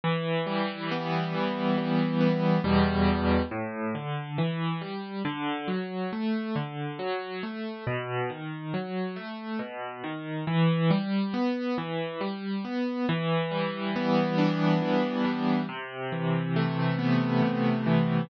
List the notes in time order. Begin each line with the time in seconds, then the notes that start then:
0.04 E3
0.47 G3
0.91 B3
1.34 E3
1.77 G3
2.20 B3
2.64 E2 B2 G3
3.51 A2
3.95 D3
4.38 E3
4.81 G3
5.25 D3
5.68 F#3
6.12 A3
6.55 D3
6.99 F#3
7.43 A3
7.87 B2
8.30 D#3
8.74 F#3
9.16 A3
9.59 B2
10.04 D#3
10.47 E3
10.90 G3
11.34 B3
11.78 E3
12.21 G3
12.64 B3
13.09 E3
13.51 G3
13.96 B3
14.38 D4
14.82 E3
15.25 G3
15.69 C3
16.12 E3
16.56 A3
16.99 B3
17.42 C3
17.86 E3